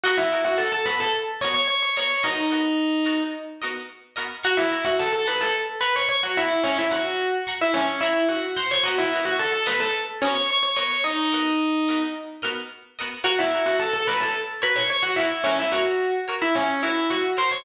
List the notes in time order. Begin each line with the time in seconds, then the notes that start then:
0.04 B3 F#4 A#4 D#5 F#5
0.17 E4 E5
0.32 B3 F#4 A#4 D#5
0.44 F#4 F#5
0.58 A4 A5
0.72 A4 A5
0.86 B3 F#4 A#4 B4 D#5 B5
1.00 A4 A5
1.41 B3 F#4 A#4 C#5 D#5 C#6
1.54 C#5 C#6
1.68 C#5 C#6
1.83 C#5 C#6
1.97 B3 F#4 A#4 C#5 D#5 C#6
2.23 B3 D#4 F#4 A#4 D#5
2.50 B3 F#4 A#4 D#5
3.05 B3 F#4 A#4 D#5
3.62 B3 F#4 A#4 D#5
4.16 B3 F#4 A#4 D#5
4.43 F#4 F#5 A#5 C#6
4.57 E4 E5
4.72 F#5 A#5 C#6
4.85 F#4 F#5
4.99 A4 A5
5.13 A4 A5
5.26 B4 F#5 A#5 B5 C#6
5.41 A4 A5
5.81 B4 F#5 A#5 B5 C#6
5.96 C#5 C#6
6.09 C#5 C#6
6.23 F#4 F#5
6.37 E4 E5 F#5 A#5 C#6
6.63 C#4 C#5 F#5 A#5 C#6
6.78 E4 E5
6.91 F#4 F#5 A#5 C#6
7.47 F#5 A#5 C#6
7.61 E4 E5
7.74 C#4 C#5
8.01 E4 E5 F#5 A#5 C#6
8.29 F#4 F#5
8.56 C5 F#5 A#5 C6 C#6
8.71 C#5 C#6
8.83 F#4 A#4 D#5 F#5
8.88 B3
8.98 E4 E5
9.13 B3 F#4 A#4 D#5
9.25 F#4 F#5
9.39 A4 A5
9.53 A4 A5
9.66 B3 F#4 A#4 B4 D#5 B5
9.80 A4 A5
10.22 B3 C#4 F#4 A#4 C#5 D#5
10.35 C#5 C#6
10.50 C#5 C#6
10.63 C#5 C#6
10.76 B3 F#4 A#4 C#5 D#5 C#6
11.04 D#4 D#5
11.32 B3 F#4 A#4 D#5
11.88 B3 F#4 A#4 D#5
12.42 B3 F#4 A#4 D#5
12.99 B3 F#4 A#4 D#5
13.24 F#4 A#4 C#5 F#5
13.39 E4 E5
13.53 F#4 A#4 C#5
13.66 F#4 F#5
13.80 A4 A5
13.93 A4 A5
14.07 F#4 A#4 B4 C#5 B5
14.20 A4 A5
14.62 F#4 A#4 B4 C#5 B5
14.76 C#5 C#6
14.90 C#5 C#6
15.03 F#4 F#5
15.16 E4 A#4 C#5 E5
15.21 F#4
15.44 C#4 F#4 A#4 C#5
15.59 E4 E5
15.72 F#4 A#4 C#5 F#5
16.28 F#4 A#4 C#5
16.42 E4 E5
16.55 C#4 C#5
16.83 E4 F#4 A#4 C#5 E5
17.10 F#4 F#5
17.37 F#4 A#4 C5 C#5 C6
17.51 C#5 C#6